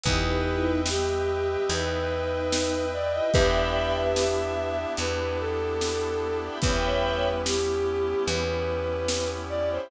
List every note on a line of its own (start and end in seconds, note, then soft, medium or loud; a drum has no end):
0.04 1.57 E2 medium
0.04 0.81 B3 medium
0.04 0.71 D#4 medium
0.04 0.81 D#4 loud
0.04 0.71 E4 loud
0.04 0.71 G4 loud
0.04 0.78 B4 loud
0.04 0.71 B4 loud
0.04 3.31 B4 medium
0.04 3.31 D#5 medium
0.04 3.31 E5 medium
0.04 3.31 G5 medium
0.04 kick loud
0.04 closed hi-hat loud
0.86 1.62 G3 medium
0.86 1.62 B3 medium
0.86 1.69 G4 medium
0.86 snare loud
1.69 3.21 E2 medium
1.69 2.85 B3 medium
1.69 2.85 D#4 medium
1.69 2.91 B4 medium
1.69 closed hi-hat loud
2.52 snare loud
2.92 3.12 D5 medium
3.13 3.30 D#4 medium
3.13 3.30 E4 loud
3.13 3.30 G4 loud
3.13 3.30 B4 loud
3.13 3.32 D#5 medium
3.33 4.86 E2 medium
3.33 6.59 B3 medium
3.33 6.59 D4 medium
3.33 6.59 E4 medium
3.33 6.59 G4 medium
3.33 4.77 G4 medium
3.33 4.77 B4 loud
3.33 4.00 D5 loud
3.33 4.14 E5 loud
3.33 4.00 E5 loud
3.33 4.00 G5 loud
3.33 4.00 B5 loud
3.33 kick loud
3.33 closed hi-hat loud
4.16 4.90 E5 medium
4.16 snare loud
4.97 6.49 E2 medium
4.97 5.39 B4 medium
4.97 closed hi-hat loud
5.40 6.39 A4 loud
5.81 snare loud
6.42 6.59 D5 medium
6.42 6.59 E5 medium
6.42 6.59 G5 loud
6.42 6.59 B5 loud
6.62 8.15 E2 medium
6.62 8.43 G3 medium
6.62 9.88 B3 medium
6.62 8.43 B3 medium
6.62 9.88 C#4 medium
6.62 9.88 E4 medium
6.62 9.88 G4 medium
6.62 7.41 B4 loud
6.62 7.29 C#5 loud
6.62 7.29 E5 loud
6.62 7.29 G5 loud
6.62 7.29 B5 loud
6.62 kick loud
6.62 closed hi-hat loud
7.45 8.23 G4 medium
7.45 snare loud
8.26 9.79 E2 medium
8.26 9.30 B4 medium
8.26 closed hi-hat loud
9.08 snare loud
9.49 9.69 D5 medium
9.71 9.90 C5 medium
9.71 9.88 C#5 medium
9.71 9.88 E5 medium
9.71 9.88 G5 medium
9.71 9.88 B5 medium